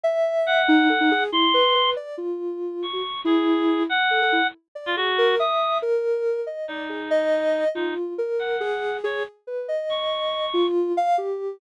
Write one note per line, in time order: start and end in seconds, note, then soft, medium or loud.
0.03 0.61 E5 loud
0.46 1.23 F#5 loud
0.68 0.87 D#4 loud
0.89 0.99 A4 medium
1.00 1.10 D#4 medium
1.11 1.31 G#4 loud
1.32 1.52 E4 medium
1.32 1.90 C6 loud
1.54 1.73 B4 medium
1.75 1.94 B4 medium
1.96 2.16 D5 medium
2.17 2.85 F4 medium
2.82 3.21 C#6 medium
2.93 3.03 F#4 soft
3.25 3.82 E4 loud
3.25 3.83 G#4 medium
3.89 4.47 F#5 loud
4.11 4.20 A4 medium
4.22 4.32 A4 medium
4.32 4.42 E4 medium
4.75 4.94 D5 medium
4.86 4.96 F4 medium
4.97 5.35 F#4 loud
4.97 5.16 G#4 medium
5.18 5.37 A#4 loud
5.39 5.78 E5 medium
5.39 5.78 D#6 medium
5.82 6.40 A#4 medium
6.47 6.66 D#5 medium
6.68 7.64 D#4 medium
6.68 6.88 D5 medium
6.89 7.09 G#4 medium
7.11 7.68 D#5 loud
7.75 7.94 D#4 medium
7.75 8.13 F4 medium
8.18 8.57 A#4 medium
8.39 8.97 F#5 medium
8.60 8.99 G#4 loud
9.04 9.23 G#4 loud
9.04 9.23 C#5 medium
9.47 9.66 B4 medium
9.68 10.45 D#5 medium
9.89 10.67 C#6 medium
10.54 10.92 F4 loud
10.97 11.16 F5 loud
11.18 11.56 G4 medium